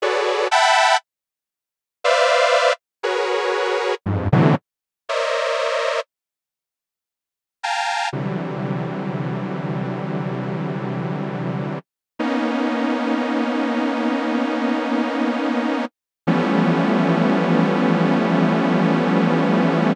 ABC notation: X:1
M:4/4
L:1/16
Q:1/4=59
K:none
V:1 name="Lead 2 (sawtooth)"
[^F^GAB^cd]2 [e^f=gab]2 z4 [B=cde=f]3 z [^F^G^AB^c]4 | [F,,G,,^G,,] [A,,B,,C,D,E,^F,] z2 [^Ac^cd^de]4 z6 [=f=g^g=a^a]2 | [C,D,E,^F,G,]16 | [^A,B,^C^D]16 |
[E,F,G,A,B,^C]16 |]